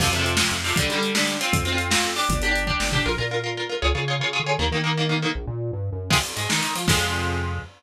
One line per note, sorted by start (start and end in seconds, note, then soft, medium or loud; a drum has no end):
0.00 0.43 F2 loud
0.00 0.10 C3 medium
0.00 0.10 F3 medium
0.00 kick medium
0.00 crash medium
0.12 0.17 C3 medium
0.12 0.17 F3 medium
0.12 closed hi-hat medium
0.19 0.35 C3 medium
0.19 0.35 F3 medium
0.26 closed hi-hat medium
0.37 0.58 C3 medium
0.37 0.58 F3 medium
0.37 snare loud
0.51 0.73 F2 medium
0.51 closed hi-hat medium
0.64 0.74 C3 medium
0.64 0.74 F3 medium
0.64 open hi-hat medium
0.76 0.87 D3 medium
0.76 0.87 G3 medium
0.76 kick loud
0.76 closed hi-hat loud
0.90 0.95 D3 medium
0.90 0.95 G3 medium
0.90 closed hi-hat medium
0.96 1.11 D3 medium
0.96 1.11 G3 medium
1.03 closed hi-hat medium
1.15 1.35 D3 medium
1.15 1.35 G3 medium
1.15 snare medium
1.27 closed hi-hat medium
1.41 1.64 C4 medium
1.41 1.64 F4 medium
1.41 closed hi-hat medium
1.53 1.96 F2 medium
1.53 kick loud
1.53 closed hi-hat medium
1.65 1.70 C4 medium
1.65 1.70 F4 medium
1.65 closed hi-hat medium
1.72 1.88 C4 medium
1.72 1.88 F4 medium
1.78 closed hi-hat medium
1.90 2.11 C4 medium
1.90 2.11 F4 medium
1.90 snare loud
2.03 2.26 F2 medium
2.03 closed hi-hat medium
2.16 2.39 D4 medium
2.16 2.39 G4 medium
2.16 open hi-hat medium
2.29 2.72 G1 loud
2.29 kick medium
2.29 closed hi-hat medium
2.42 2.48 D4 medium
2.42 2.48 G4 medium
2.42 closed hi-hat medium
2.49 2.64 D4 medium
2.49 2.64 G4 medium
2.55 closed hi-hat medium
2.67 2.88 D4 medium
2.67 2.88 G4 medium
2.67 kick medium
2.80 3.02 G1 medium
2.80 snare medium
2.92 3.03 D4 medium
2.92 3.03 G4 medium
2.92 floor tom loud
3.06 3.17 A#1 loud
3.06 3.11 F4 medium
3.06 3.11 A#4 medium
3.18 3.72 A#2 medium
3.18 3.23 F4 medium
3.18 3.23 A#4 medium
3.31 3.36 F4 medium
3.31 3.36 A#4 medium
3.44 3.49 F4 medium
3.44 3.49 A#4 medium
3.57 3.62 F4 medium
3.57 3.62 A#4 medium
3.69 3.75 F4 medium
3.69 3.75 A#4 medium
3.82 3.93 C#2 loud
3.82 3.87 F4 medium
3.82 3.87 G#4 medium
3.82 3.87 C#5 medium
3.95 4.19 C#3 medium
3.95 4.00 F4 medium
3.95 4.00 G#4 medium
3.95 4.00 C#5 medium
4.08 4.13 F4 medium
4.08 4.13 G#4 medium
4.08 4.13 C#5 medium
4.20 4.37 C#3 medium
4.20 4.26 F4 medium
4.20 4.26 G#4 medium
4.20 4.26 C#5 medium
4.33 4.38 F4 medium
4.33 4.38 G#4 medium
4.33 4.38 C#5 medium
4.40 4.57 D3 medium
4.46 4.51 F4 medium
4.46 4.51 G#4 medium
4.46 4.51 C#5 medium
4.59 4.70 D#2 loud
4.59 4.64 D#3 medium
4.59 4.64 A#3 medium
4.71 5.26 D#3 loud
4.71 4.77 D#3 medium
4.71 4.77 A#3 medium
4.84 4.89 D#3 medium
4.84 4.89 A#3 medium
4.97 5.03 D#3 medium
4.97 5.03 A#3 medium
5.09 5.14 D#3 medium
5.09 5.14 A#3 medium
5.22 5.27 D#3 medium
5.22 5.27 A#3 medium
5.35 5.46 A#1 medium
5.47 5.71 A#2 medium
5.73 5.90 G2 medium
5.92 6.10 F#2 medium
6.10 6.33 F2 medium
6.10 6.15 C3 loud
6.10 6.15 F3 medium
6.10 6.15 G#3 loud
6.10 kick loud
6.10 crash loud
6.23 ride medium
6.36 6.48 G#2 medium
6.36 6.47 G#3 medium
6.36 ride medium
6.49 6.61 D#3 medium
6.49 6.60 D#4 medium
6.49 snare medium
6.62 6.74 D#3 medium
6.62 6.73 D#4 medium
6.62 ride medium
6.75 6.86 F3 medium
6.75 6.87 F4 medium
6.75 ride medium
6.88 7.59 F2 loud
6.88 7.59 C3 loud
6.88 7.59 F3 loud
6.88 7.59 G#3 medium
6.88 kick loud
6.88 crash loud